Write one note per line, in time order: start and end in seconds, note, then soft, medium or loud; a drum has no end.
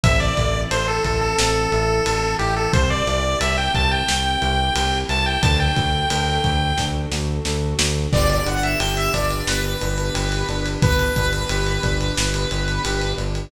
0.04 0.32 A1 loud
0.04 2.71 C4 medium
0.04 0.34 C4 medium
0.04 2.71 E4 medium
0.04 2.71 A4 medium
0.04 0.20 E5 loud
0.04 kick loud
0.04 ride loud
0.20 0.61 D5 loud
0.37 0.66 A1 medium
0.37 0.68 E4 medium
0.37 kick medium
0.37 ride medium
0.71 0.99 A1 medium
0.71 1.01 A4 medium
0.71 0.87 C5 loud
0.71 ride medium
0.88 1.04 A4 loud
1.04 1.34 A1 medium
1.04 1.34 E4 medium
1.04 1.21 A4 medium
1.04 kick medium
1.04 ride medium
1.21 2.35 A4 loud
1.38 1.67 A1 medium
1.38 1.69 C4 medium
1.38 snare loud
1.72 2.01 A1 medium
1.72 2.04 E4 medium
1.72 ride medium
2.05 2.35 A1 medium
2.05 2.36 A4 medium
2.05 ride loud
2.39 2.68 A1 medium
2.39 2.71 E4 medium
2.39 2.55 G4 loud
2.39 ride medium
2.56 2.72 A4 loud
2.72 3.02 C2 loud
2.72 5.39 C4 medium
2.72 3.03 C4 medium
2.72 5.39 E4 medium
2.72 5.39 G4 medium
2.72 2.89 C5 loud
2.72 kick loud
2.72 ride medium
2.90 3.39 D5 loud
3.07 3.36 C2 medium
3.07 3.37 E4 medium
3.07 ride medium
3.41 3.69 C2 medium
3.41 3.71 G4 medium
3.41 3.57 E5 medium
3.41 ride loud
3.58 3.74 G5 loud
3.74 4.03 C2 medium
3.74 4.04 E4 medium
3.74 3.91 A5 loud
3.74 kick medium
3.74 ride medium
3.91 4.98 G5 loud
4.08 4.37 C2 medium
4.08 4.40 C4 medium
4.08 snare loud
4.41 4.71 C2 loud
4.41 4.72 E4 medium
4.41 ride medium
4.75 5.04 C2 medium
4.75 5.05 G4 medium
4.75 ride loud
5.09 5.38 C2 medium
5.09 5.40 E4 medium
5.09 5.26 A5 loud
5.09 ride medium
5.26 5.42 G5 loud
5.42 5.71 D2 loud
5.42 5.73 D4 medium
5.42 8.10 D4 medium
5.42 8.10 F#4 medium
5.42 8.10 A4 medium
5.42 5.59 A5 loud
5.42 kick loud
5.42 ride medium
5.60 6.85 G5 loud
5.76 6.05 D2 medium
5.76 6.06 F#4 medium
5.76 kick medium
5.76 ride medium
6.10 6.39 D2 medium
6.10 6.41 A4 medium
6.10 ride loud
6.44 6.73 D2 medium
6.44 6.75 F#4 medium
6.44 kick medium
6.44 ride medium
6.78 7.06 D2 medium
6.78 7.09 D4 medium
6.78 kick medium
6.78 snare medium
7.12 7.40 D2 medium
7.12 7.43 F#4 medium
7.12 snare medium
7.45 7.74 D2 medium
7.45 7.77 A4 medium
7.45 snare medium
7.79 8.07 D2 loud
7.79 8.09 F#4 medium
7.79 snare loud
8.12 8.41 G1 loud
8.12 13.45 B3 medium
8.12 8.43 B3 loud
8.12 13.45 D4 medium
8.12 13.45 G4 medium
8.12 8.29 D5 loud
8.12 kick loud
8.12 crash medium
8.29 8.46 D5 loud
8.29 ride medium
8.45 8.75 G1 medium
8.45 8.76 D4 medium
8.45 8.63 F#5 medium
8.45 ride medium
8.63 8.79 E5 medium
8.63 ride medium
8.79 9.09 G1 medium
8.79 9.10 G4 medium
8.79 8.95 G5 medium
8.79 ride medium
8.97 9.13 E5 loud
8.97 ride medium
9.13 9.43 G1 medium
9.13 9.45 D4 medium
9.13 9.46 D5 medium
9.13 kick medium
9.13 ride medium
9.30 ride medium
9.47 9.76 G1 medium
9.47 9.78 B3 medium
9.47 10.69 B4 medium
9.47 snare medium
9.64 ride medium
9.81 10.10 G1 medium
9.81 10.12 D4 medium
9.81 ride medium
9.98 ride medium
10.14 10.43 G1 loud
10.14 10.44 G4 medium
10.14 ride medium
10.32 ride medium
10.49 10.77 G1 medium
10.49 10.79 D4 loud
10.49 ride medium
10.66 ride medium
10.82 11.11 G1 medium
10.82 11.12 B3 medium
10.82 13.12 B4 loud
10.82 kick loud
10.82 ride medium
10.99 ride medium
11.16 11.45 G1 medium
11.16 11.47 D4 medium
11.16 kick medium
11.16 ride medium
11.33 ride medium
11.49 11.79 G1 loud
11.49 11.80 G4 medium
11.49 ride medium
11.67 ride medium
11.83 12.12 G1 medium
11.83 12.13 D4 medium
11.83 kick medium
11.83 ride medium
12.01 ride medium
12.17 12.46 G1 medium
12.17 12.48 B3 medium
12.17 snare loud
12.34 ride medium
12.51 12.79 G1 medium
12.51 12.81 D4 medium
12.51 ride medium
12.68 ride medium
12.85 13.13 G1 medium
12.85 13.15 G4 medium
12.85 ride medium
13.01 ride medium
13.17 13.47 G1 medium
13.17 13.48 D4 medium
13.17 ride medium
13.35 ride medium